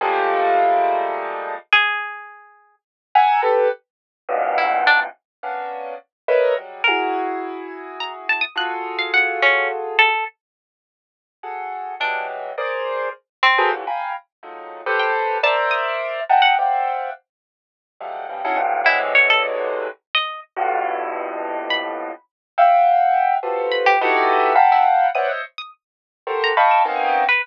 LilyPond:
<<
  \new Staff \with { instrumentName = "Acoustic Grand Piano" } { \time 3/4 \tempo 4 = 105 <f g gis a ais>2. | r2 r8 <e'' fis'' gis'' ais''>8 | <g' a' b'>8 r4 <e, fis, g, gis, ais, b,>4. | r8 <ais b cis' d'>4 r8 <ais' b' cis'' dis'' e''>8 <fis g gis>8 |
<e' fis' gis'>2. | <f' fis' gis' a'>2. | r2 <fis' gis' a'>4 | <e fis g gis>4 <gis' ais' c'' d''>4 r8. <fis' gis' a' ais' b' c''>16 |
<ais, c d e fis>16 <f'' g'' gis'' ais'' b''>8 r8 <dis f fis gis a>8. <g' a' b' c''>4 | <ais' c'' d'' e''>4. <dis'' e'' fis'' g'' a'' ais''>8 <c'' d'' e'' f'' fis'' g''>4 | r4. <f fis g gis a>8 <cis dis e f g>16 <cis' dis' e' fis' gis' a'>16 <g, gis, a, ais,>8 | <b, c d e fis gis>2 r4 |
<f, g, a, b,>2. | r8 <e'' f'' fis'' g''>4. <f' fis' g' a' b' c''>4 | <dis' e' fis' g' a' b'>4 <f'' fis'' g'' a'' ais'' b''>4 <b' c'' cis'' d'' e'' fis''>16 <c'' cis'' dis'' e''>16 r8 | r4 <fis' g' a' ais' c''>8 <dis'' f'' g'' a'' b'' cis'''>8 <ais b c' cis' dis'>8. r16 | }
  \new Staff \with { instrumentName = "Pizzicato Strings" } { \time 3/4 r2. | gis'2 r4 | r2 e'8 d'16 r16 | r2. |
ais'2 ais''16 r16 a''16 dis'''16 | fis'''16 r8 f''16 fis''8 cis'8 r8 a'8 | r2. | d'8 r2 c'8 |
r2 r16 g''16 r8 | a''16 r16 dis'''8. r8 fis''16 r4 | r2. | e'16 r16 cis''16 a'16 r4 r16 dis''8 r16 |
r2 b''4 | r2 r8 b''16 g'16 | r4 r16 e'16 r8 dis'''16 r8 dis'''16 | r4 r16 ais''16 r16 e'''8 r8 b'16 | }
>>